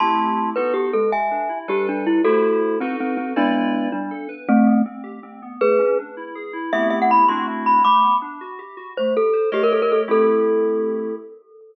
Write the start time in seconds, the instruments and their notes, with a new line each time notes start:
0.00 electric piano 2 A3 C4 E4 G4, glockenspiel A5 C6
0.56 electric piano 2 B3 D#4 F#4 A4, glockenspiel B4
0.74 glockenspiel G4
0.93 electric piano 2 G#3, glockenspiel A4
1.12 glockenspiel E5 G#5
1.31 electric piano 2 D4
1.49 electric piano 2 E4
1.68 electric piano 2 G3 D4 A4 B4, glockenspiel G4
1.89 glockenspiel D4
2.07 glockenspiel E4
2.24 electric piano 2 A3 E4 G4 C5, glockenspiel F#4 A4
2.80 glockenspiel C4, electric piano 2 D#4 F#4 A4 B4
3.00 glockenspiel C4
3.17 glockenspiel C4
3.36 electric piano 2 G#3 E4 B4 D5, glockenspiel B3 D4
3.92 electric piano 2 G3, glockenspiel D4
4.11 electric piano 2 A4
4.29 electric piano 2 B4
4.49 glockenspiel A3 C4, electric piano 2 A3
4.66 electric piano 2 B3
4.86 electric piano 2 C4
5.04 electric piano 2 G4
5.23 electric piano 2 C4
5.42 electric piano 2 B3
5.61 electric piano 2 A3, glockenspiel G#4 B4
5.79 electric piano 2 C#4
5.99 electric piano 2 D4
6.17 electric piano 2 E4
6.35 electric piano 2 G#4
6.53 electric piano 2 E4
6.73 electric piano 2 A3 B3 C4 E4 G4, glockenspiel E5
6.90 glockenspiel E5
7.02 glockenspiel F#5
7.11 glockenspiel B5
7.29 electric piano 2 A3 C4 D4 E4 F#4, glockenspiel C6
7.66 glockenspiel B5
7.84 electric piano 2 A3, glockenspiel B5 D6
8.03 electric piano 2 B3
8.22 electric piano 2 D4
8.41 electric piano 2 F#4
8.59 electric piano 2 G4
8.77 electric piano 2 F#4
8.97 electric piano 2 A3, glockenspiel C5
9.17 electric piano 2 G4, glockenspiel A4
9.33 electric piano 2 C5
9.52 electric piano 2 A3 G4 A#4 C#5 D#5, glockenspiel G4
9.63 glockenspiel A#4
9.72 glockenspiel A4
9.82 glockenspiel A#4
9.92 glockenspiel A4
10.08 electric piano 2 A3 C4 E4 G4, glockenspiel A4